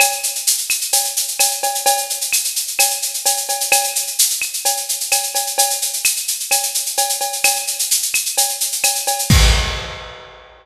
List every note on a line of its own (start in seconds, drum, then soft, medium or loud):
0.00 cowbell loud
0.00 claves loud
0.00 shaker loud
0.12 shaker medium
0.23 shaker medium
0.35 shaker medium
0.47 shaker loud
0.58 shaker medium
0.70 claves medium
0.70 shaker medium
0.81 shaker medium
0.93 cowbell medium
0.93 shaker loud
1.04 shaker medium
1.16 shaker loud
1.28 shaker medium
1.39 cowbell medium
1.39 claves medium
1.39 shaker loud
1.51 shaker medium
1.63 cowbell medium
1.63 shaker medium
1.75 shaker medium
1.86 cowbell loud
1.86 shaker loud
1.97 shaker medium
2.10 shaker medium
2.21 shaker medium
2.33 claves medium
2.33 shaker loud
2.44 shaker medium
2.56 shaker medium
2.67 shaker medium
2.79 cowbell medium
2.79 claves loud
2.79 shaker loud
2.91 shaker medium
3.02 shaker medium
3.14 shaker medium
3.26 cowbell medium
3.26 shaker loud
3.37 shaker medium
3.49 cowbell medium
3.49 shaker medium
3.60 shaker medium
3.72 cowbell loud
3.72 claves loud
3.72 shaker loud
3.84 shaker medium
3.95 shaker medium
4.07 shaker medium
4.19 shaker loud
4.30 shaker medium
4.42 claves medium
4.42 shaker medium
4.53 shaker medium
4.65 cowbell medium
4.65 shaker loud
4.77 shaker medium
4.89 shaker medium
5.00 shaker medium
5.12 cowbell medium
5.12 claves medium
5.12 shaker loud
5.23 shaker medium
5.35 cowbell medium
5.35 shaker medium
5.47 shaker medium
5.58 cowbell loud
5.58 shaker loud
5.70 shaker medium
5.82 shaker medium
5.93 shaker medium
6.05 claves loud
6.05 shaker loud
6.16 shaker medium
6.28 shaker medium
6.40 shaker medium
6.51 cowbell medium
6.51 claves medium
6.51 shaker loud
6.63 shaker medium
6.74 shaker medium
6.86 shaker medium
6.97 cowbell medium
6.97 shaker loud
7.09 shaker medium
7.21 cowbell medium
7.21 shaker medium
7.33 shaker medium
7.44 cowbell medium
7.44 claves loud
7.44 shaker loud
7.56 shaker medium
7.67 shaker medium
7.79 shaker medium
7.91 shaker loud
8.02 shaker medium
8.14 claves loud
8.14 shaker medium
8.25 shaker medium
8.37 cowbell medium
8.37 shaker loud
8.49 shaker medium
8.60 shaker medium
8.72 shaker medium
8.84 cowbell medium
8.84 claves loud
8.84 shaker loud
8.95 shaker medium
9.07 cowbell medium
9.07 shaker medium
9.19 shaker medium
9.30 kick loud
9.30 crash loud